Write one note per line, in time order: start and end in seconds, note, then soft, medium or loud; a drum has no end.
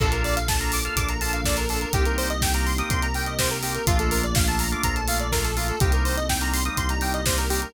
0.00 0.89 A#1 medium
0.00 0.96 A#3 medium
0.00 0.39 A#3 loud
0.00 0.96 D4 medium
0.00 0.39 D4 loud
0.00 0.96 F4 medium
0.00 0.39 F4 loud
0.00 0.96 A4 medium
0.00 0.11 A4 loud
0.00 0.39 A4 medium
0.00 kick loud
0.00 crash loud
0.12 0.23 A#4 medium
0.12 closed hi-hat medium
0.24 0.35 D5 medium
0.24 open hi-hat medium
0.36 0.47 F5 medium
0.36 closed hi-hat loud
0.48 0.59 A5 medium
0.48 kick loud
0.48 snare loud
0.60 0.80 A#3 medium
0.60 0.80 D4 medium
0.60 0.80 F4 medium
0.60 0.80 A4 medium
0.60 0.71 A#5 medium
0.60 closed hi-hat medium
0.72 0.84 D6 medium
0.72 open hi-hat loud
0.85 1.14 A#3 medium
0.85 1.14 D4 medium
0.85 1.14 F4 medium
0.85 1.14 A4 medium
0.85 0.96 F6 medium
0.85 closed hi-hat medium
0.96 1.85 A#1 medium
0.96 1.93 A#3 medium
0.96 1.93 D4 medium
0.96 1.93 A4 medium
0.96 1.93 A#4 medium
0.96 1.08 D6 medium
0.96 kick medium
0.96 closed hi-hat loud
1.09 1.20 A#5 medium
1.09 closed hi-hat medium
1.21 1.41 A#3 medium
1.21 1.41 D4 medium
1.21 1.41 F4 loud
1.21 1.41 A4 medium
1.21 1.32 A5 medium
1.21 open hi-hat medium
1.33 1.44 F5 medium
1.33 closed hi-hat medium
1.45 1.65 A#3 medium
1.45 1.65 D4 medium
1.45 1.65 F4 medium
1.45 1.65 A4 medium
1.45 1.56 D5 medium
1.45 kick medium
1.45 snare loud
1.57 1.68 A#4 medium
1.57 closed hi-hat medium
1.69 1.89 A#3 medium
1.69 1.89 D4 medium
1.69 1.89 F4 medium
1.69 1.80 A4 medium
1.69 1.89 A4 medium
1.69 open hi-hat medium
1.81 1.92 A#4 medium
1.81 closed hi-hat medium
1.93 2.82 C2 medium
1.93 2.89 A#3 medium
1.93 2.32 A#3 medium
1.93 2.89 C4 medium
1.93 2.32 C4 loud
1.93 2.89 D#4 medium
1.93 2.32 D#4 loud
1.93 2.04 G4 loud
1.93 2.89 G4 medium
1.93 2.32 G4 medium
1.93 kick loud
1.93 closed hi-hat loud
2.05 2.17 A#4 medium
2.05 closed hi-hat medium
2.18 2.29 C5 medium
2.18 open hi-hat medium
2.30 2.41 D#5 medium
2.30 closed hi-hat medium
2.41 2.53 G5 medium
2.41 kick loud
2.41 snare loud
2.54 2.73 A#3 medium
2.54 2.73 C4 medium
2.54 2.73 D#4 medium
2.54 2.73 G4 medium
2.54 2.65 A#5 medium
2.54 closed hi-hat medium
2.66 2.77 C6 medium
2.66 open hi-hat medium
2.78 3.07 A#3 medium
2.78 3.07 C4 loud
2.78 3.07 D#4 medium
2.78 3.07 G4 loud
2.78 2.89 D#6 medium
2.78 closed hi-hat medium
2.90 3.79 C2 medium
2.90 3.86 A#3 medium
2.90 3.86 C4 medium
2.90 3.86 G4 medium
2.90 3.86 A#4 medium
2.90 3.01 C6 medium
2.90 kick loud
2.90 closed hi-hat loud
3.02 3.13 A#5 medium
3.02 closed hi-hat medium
3.14 3.34 A#3 medium
3.14 3.34 C4 medium
3.14 3.34 D#4 medium
3.14 3.34 G4 medium
3.14 3.26 G5 medium
3.14 open hi-hat medium
3.26 3.38 D#5 medium
3.26 closed hi-hat medium
3.39 3.58 A#3 loud
3.39 3.58 C4 medium
3.39 3.58 D#4 medium
3.39 3.58 G4 medium
3.39 3.50 C5 medium
3.39 kick medium
3.39 snare loud
3.51 3.62 A#4 medium
3.51 closed hi-hat medium
3.63 3.82 A#3 medium
3.63 3.82 C4 medium
3.63 3.82 D#4 medium
3.63 3.82 G4 medium
3.63 3.74 G4 medium
3.63 open hi-hat loud
3.75 3.86 A#4 medium
3.75 closed hi-hat medium
3.86 4.76 A#1 medium
3.86 4.26 A3 loud
3.86 4.83 A3 medium
3.86 4.26 A#3 loud
3.86 4.83 A#3 medium
3.86 4.26 D4 loud
3.86 4.83 D4 medium
3.86 4.26 F4 loud
3.86 3.98 F4 loud
3.86 4.83 F4 medium
3.86 kick loud
3.86 closed hi-hat loud
3.99 4.10 A4 medium
3.99 closed hi-hat medium
4.11 4.22 A#4 medium
4.11 open hi-hat loud
4.23 4.34 D5 medium
4.23 closed hi-hat medium
4.35 4.46 F5 medium
4.35 kick loud
4.35 snare loud
4.48 4.67 A3 medium
4.48 4.67 A#3 medium
4.48 4.67 D4 medium
4.48 4.67 F4 medium
4.48 4.59 A5 medium
4.48 closed hi-hat medium
4.59 4.71 A#5 medium
4.59 open hi-hat loud
4.72 5.01 A3 medium
4.72 5.01 A#3 loud
4.72 5.01 D4 medium
4.72 5.01 F4 medium
4.72 4.83 D6 medium
4.72 closed hi-hat medium
4.83 5.73 A#1 medium
4.83 5.80 A3 medium
4.83 5.80 A#3 medium
4.83 5.80 F4 medium
4.83 5.80 A4 medium
4.83 4.95 A#5 medium
4.83 kick medium
4.83 closed hi-hat loud
4.96 5.07 A5 medium
4.96 closed hi-hat medium
5.08 5.27 A3 medium
5.08 5.27 A#3 medium
5.08 5.27 D4 medium
5.08 5.27 F4 medium
5.08 5.19 F5 medium
5.08 open hi-hat loud
5.20 5.31 D5 medium
5.20 closed hi-hat medium
5.32 5.52 A3 medium
5.32 5.52 A#3 medium
5.32 5.52 D4 medium
5.32 5.52 F4 medium
5.32 5.43 A#4 medium
5.32 kick medium
5.32 snare loud
5.44 5.55 A4 medium
5.44 closed hi-hat medium
5.56 5.76 A3 medium
5.56 5.76 A#3 medium
5.56 5.76 D4 medium
5.56 5.67 F4 medium
5.56 5.76 F4 medium
5.56 open hi-hat medium
5.68 5.79 A4 medium
5.68 closed hi-hat medium
5.80 6.70 C2 medium
5.80 6.77 G3 medium
5.80 6.20 G3 loud
5.80 6.77 A#3 medium
5.80 6.20 A#3 medium
5.80 6.77 C4 medium
5.80 6.20 C4 loud
5.80 6.77 D#4 medium
5.80 6.20 D#4 loud
5.80 5.92 G4 medium
5.80 kick loud
5.80 closed hi-hat loud
5.92 6.04 A#4 medium
5.92 closed hi-hat medium
6.05 6.16 C5 medium
6.05 open hi-hat medium
6.17 6.28 D#5 medium
6.17 closed hi-hat medium
6.29 6.40 G5 medium
6.29 kick medium
6.29 snare loud
6.41 6.60 G3 medium
6.41 6.60 A#3 medium
6.41 6.60 C4 medium
6.41 6.60 D#4 medium
6.41 6.52 A#5 medium
6.41 closed hi-hat medium
6.53 6.64 C6 medium
6.53 open hi-hat loud
6.65 6.94 G3 medium
6.65 6.94 A#3 medium
6.65 6.94 C4 medium
6.65 6.94 D#4 medium
6.65 6.76 D#6 medium
6.65 closed hi-hat medium
6.77 7.66 C2 medium
6.77 7.73 G3 medium
6.77 7.73 A#3 medium
6.77 7.73 D#4 medium
6.77 7.73 G4 medium
6.77 6.88 C6 medium
6.77 kick medium
6.77 closed hi-hat loud
6.89 7.01 A#5 medium
6.89 closed hi-hat medium
7.01 7.21 G3 medium
7.01 7.21 A#3 medium
7.01 7.21 C4 medium
7.01 7.21 D#4 medium
7.01 7.12 G5 medium
7.01 open hi-hat medium
7.14 7.25 D#5 medium
7.14 closed hi-hat medium
7.26 7.46 G3 medium
7.26 7.46 A#3 medium
7.26 7.46 C4 medium
7.26 7.46 D#4 medium
7.26 7.37 C5 medium
7.26 kick medium
7.26 snare loud
7.38 7.49 A#4 medium
7.38 closed hi-hat medium
7.50 7.69 G3 medium
7.50 7.69 A#3 medium
7.50 7.69 C4 loud
7.50 7.69 D#4 medium
7.50 7.61 G4 medium
7.50 open hi-hat loud
7.62 7.73 A#4 medium
7.62 closed hi-hat medium